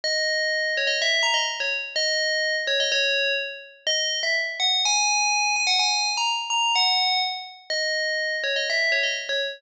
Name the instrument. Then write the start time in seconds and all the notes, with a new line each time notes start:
tubular bells
0.04 D#5
0.77 C#5
0.87 D#5
1.02 E5
1.23 A#5
1.34 D#5
1.60 C#5
1.96 D#5
2.67 C#5
2.80 D#5
2.92 C#5
3.87 D#5
4.23 E5
4.60 F#5
4.85 G#5
5.56 G#5
5.67 F#5
5.79 G#5
6.17 A#5
6.50 A#5
6.75 F#5
7.70 D#5
8.44 C#5
8.56 D#5
8.70 E5
8.92 C#5
9.03 D#5
9.29 C#5